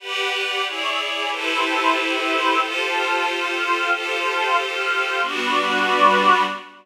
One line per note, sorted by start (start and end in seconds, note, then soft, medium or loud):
0.00 0.64 G4 loud
0.00 0.32 G4 medium
0.00 0.64 B4 loud
0.00 0.64 D5 medium
0.00 0.64 F#5 medium
0.00 0.32 F#5 medium
0.00 0.33 B5 medium
0.00 0.32 D6 medium
0.32 0.65 G4 medium
0.32 0.65 F#5 medium
0.32 0.65 G5 medium
0.32 0.65 D6 medium
0.65 1.30 E4 medium
0.65 1.30 G#4 medium
0.65 1.30 C#5 medium
0.65 1.30 D5 medium
0.65 0.97 E5 medium
0.65 0.97 G#5 medium
0.65 0.97 C#6 medium
0.65 0.97 D6 medium
0.99 1.30 E5 medium
0.99 1.31 G#5 medium
0.99 1.30 B5 medium
0.99 1.31 D6 medium
1.30 2.59 E4 loud
1.30 2.59 G4 medium
1.30 2.59 A4 medium
1.30 2.59 B4 medium
1.30 2.59 C5 loud
1.30 1.95 E5 medium
1.30 1.95 G5 medium
1.30 1.96 A5 medium
1.30 1.95 B5 medium
1.30 1.95 C6 medium
1.96 2.60 E5 medium
1.96 2.60 G5 medium
1.96 2.60 B5 medium
1.96 2.60 C6 medium
1.96 2.60 E6 medium
2.60 3.89 F4 medium
2.60 3.89 G4 medium
2.60 3.89 A4 medium
2.60 3.89 C5 loud
2.60 3.25 F5 medium
2.60 3.25 G5 medium
2.60 3.25 A5 medium
2.60 3.25 C6 medium
3.26 3.91 F5 medium
3.26 3.91 G5 medium
3.26 3.91 C6 medium
3.26 3.91 F6 medium
3.91 5.20 F4 medium
3.91 5.20 G4 medium
3.91 5.20 A4 loud
3.91 5.20 C5 medium
3.91 4.56 F5 medium
3.91 4.56 G5 medium
3.91 4.56 A5 medium
3.91 4.56 C6 medium
4.56 5.21 F5 medium
4.56 5.21 G5 medium
4.56 5.21 C6 medium
4.56 5.21 F6 medium
5.22 6.43 G3 medium
5.22 6.43 B3 medium
5.22 6.43 D4 medium
5.22 6.43 F#4 loud
5.22 6.43 B4 loud
5.22 6.43 D5 loud